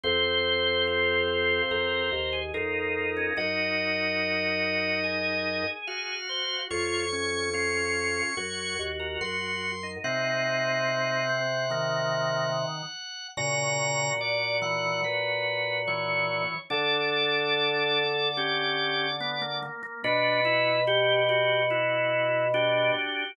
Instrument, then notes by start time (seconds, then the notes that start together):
drawbar organ
0.03 F2 C4 C5
0.87 F4
1.71 F2 A#4
2.12 D#2
2.33 G#4
2.54 F2 D#4 F4 A#4
3.17 C#4
3.37 F#2 D#4 F#4 D#5
5.04 G#4
5.87 F#4 F5
6.29 C5
6.70 F2 F4 C#5 C#6
7.12 C#4
7.53 C#4 F4
8.37 F#2 F#4 C#5
8.79 D#2
8.99 A#4
9.21 F#2 F#4 C6
9.83 D#4
10.04 C3 C4 D#4 F#5
10.88 D#4
11.29 C4
11.70 D#3 A#3
13.37 A#2 C#3 F#4 A#5
14.21 D5
14.62 E3 F#5
15.04 B4
15.87 E3 C#5
16.70 D3 D4 A4 D5
18.37 C#4 G4
19.20 B3
19.42 A#3
19.62 A#3
19.83 A#3
20.04 B2 D4 F#4 B4
20.45 E4
20.87 F#4 G4
21.29 F#4 G4
21.70 E4 F#4
22.54 D4 F#4 G4